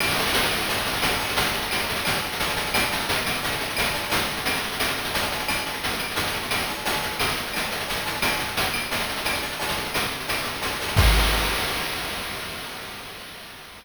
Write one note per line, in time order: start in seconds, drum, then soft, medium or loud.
0.00 crash loud
0.00 cowbell medium
0.00 claves loud
0.09 shaker medium
0.19 shaker medium
0.26 shaker medium
0.34 shaker loud
0.43 shaker medium
0.51 claves medium
0.51 shaker medium
0.60 shaker medium
0.69 cowbell medium
0.69 shaker medium
0.77 shaker medium
0.86 shaker medium
0.93 shaker medium
1.02 cowbell medium
1.02 claves medium
1.02 shaker loud
1.12 shaker medium
1.20 cowbell medium
1.20 shaker medium
1.29 shaker medium
1.36 cowbell medium
1.36 shaker loud
1.46 shaker medium
1.54 shaker medium
1.62 shaker medium
1.71 claves medium
1.71 shaker loud
1.80 shaker medium
1.89 shaker medium
1.96 shaker medium
2.05 cowbell medium
2.05 claves medium
2.05 shaker loud
2.15 shaker medium
2.24 shaker medium
2.32 shaker medium
2.40 cowbell medium
2.40 shaker loud
2.49 shaker medium
2.56 cowbell medium
2.56 shaker medium
2.66 shaker medium
2.74 cowbell loud
2.74 claves loud
2.74 shaker loud
2.84 shaker medium
2.92 shaker medium
2.99 shaker medium
3.09 shaker loud
3.16 shaker medium
3.26 snare soft
3.26 claves medium
3.26 shaker medium
3.34 shaker medium
3.43 cowbell medium
3.43 shaker medium
3.52 shaker medium
3.60 snare soft
3.60 shaker medium
3.70 shaker medium
3.77 cowbell medium
3.77 claves loud
3.77 shaker loud
3.85 shaker medium
3.94 cowbell medium
3.94 shaker medium
4.03 shaker medium
4.10 cowbell medium
4.10 shaker loud
4.19 shaker medium
4.29 shaker medium
4.37 shaker medium
4.45 claves medium
4.45 shaker loud
4.55 shaker medium
4.63 shaker medium
4.72 shaker medium
4.80 cowbell medium
4.80 claves medium
4.80 shaker loud
4.87 shaker medium
4.97 shaker medium
5.04 shaker medium
5.14 cowbell medium
5.14 shaker loud
5.22 shaker medium
5.31 cowbell medium
5.31 shaker medium
5.39 shaker medium
5.48 cowbell medium
5.48 claves loud
5.48 shaker medium
5.57 shaker medium
5.66 shaker medium
5.74 shaker medium
5.84 shaker medium
5.93 shaker medium
5.99 claves medium
5.99 shaker medium
6.10 shaker medium
6.16 cowbell medium
6.16 shaker loud
6.27 shaker medium
6.34 shaker medium
6.42 shaker medium
6.51 cowbell medium
6.51 claves medium
6.51 shaker loud
6.59 shaker medium
6.68 cowbell medium
6.68 shaker medium
6.77 snare soft
6.77 shaker medium
6.86 cowbell loud
6.86 shaker loud
6.93 shaker medium
7.03 shaker medium
7.11 shaker medium
7.19 claves medium
7.19 shaker loud
7.28 shaker medium
7.37 shaker medium
7.47 shaker medium
7.53 cowbell medium
7.53 claves medium
7.53 shaker medium
7.62 shaker medium
7.71 shaker medium
7.80 shaker medium
7.88 cowbell medium
7.88 shaker medium
7.96 shaker medium
8.06 cowbell medium
8.06 shaker medium
8.13 shaker medium
8.22 cowbell medium
8.22 claves loud
8.22 shaker loud
8.32 shaker medium
8.39 shaker medium
8.48 shaker medium
8.57 shaker loud
8.66 shaker medium
8.74 claves loud
8.74 shaker medium
8.83 shaker medium
8.91 cowbell medium
8.91 shaker loud
8.99 shaker medium
9.09 snare soft
9.09 shaker medium
9.16 shaker medium
9.25 cowbell medium
9.25 claves medium
9.25 shaker medium
9.34 shaker medium
9.42 cowbell medium
9.42 shaker medium
9.51 shaker medium
9.60 cowbell medium
9.60 shaker medium
9.69 shaker medium
9.77 shaker medium
9.86 shaker medium
9.94 claves medium
9.94 shaker loud
10.03 shaker medium
10.10 shaker medium
10.20 shaker medium
10.28 cowbell medium
10.28 claves medium
10.28 shaker medium
10.37 shaker medium
10.44 shaker medium
10.55 shaker medium
10.62 cowbell medium
10.62 shaker medium
10.72 shaker medium
10.80 cowbell medium
10.80 shaker medium
10.88 shaker medium
10.96 kick loud
10.96 crash loud